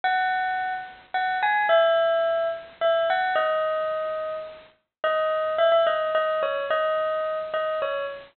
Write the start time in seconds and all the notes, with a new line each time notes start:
0.04 F#5
1.14 F#5
1.42 G#5
1.69 E5
2.81 E5
3.10 F#5
3.35 D#5
5.04 D#5
5.58 E5
5.72 E5
5.87 D#5
6.15 D#5
6.43 C#5
6.70 D#5
7.54 D#5
7.82 C#5